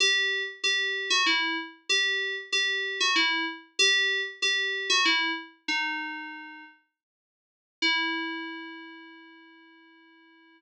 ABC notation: X:1
M:3/4
L:1/16
Q:1/4=95
K:Em
V:1 name="Electric Piano 2"
G3 z G3 F E2 z2 | G3 z G3 F E2 z2 | G3 z G3 F E2 z2 | "^rit." ^D6 z6 |
E12 |]